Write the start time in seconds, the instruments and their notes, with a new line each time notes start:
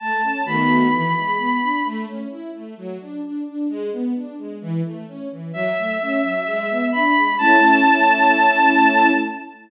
0.00 string ensemble 1 A3, violin A5
0.23 string ensemble 1 C#4
0.46 string ensemble 1 D#3 A3 B3 F#4, violin B5
0.93 string ensemble 1 E3
1.16 string ensemble 1 G#3
1.38 string ensemble 1 B3
1.62 string ensemble 1 D4
1.85 string ensemble 1 A3
2.07 string ensemble 1 C#4
2.30 string ensemble 1 E4
2.54 string ensemble 1 A3
2.77 string ensemble 1 F#3
3.00 string ensemble 1 D4
3.23 string ensemble 1 D4
3.46 string ensemble 1 D4
3.69 string ensemble 1 G#3
3.92 string ensemble 1 B3
4.15 string ensemble 1 D4
4.38 string ensemble 1 G#3
4.61 string ensemble 1 E3
4.85 string ensemble 1 A3
5.08 string ensemble 1 C#4
5.31 string ensemble 1 E3
5.53 string ensemble 1 F#3, violin E5
5.77 string ensemble 1 A3
6.01 string ensemble 1 C#4
6.23 string ensemble 1 F#3
6.46 string ensemble 1 G#3
6.70 string ensemble 1 B3
6.92 string ensemble 1 D4, violin B5
7.15 string ensemble 1 G#3
7.38 string ensemble 1 A3 C#4 E4, violin A5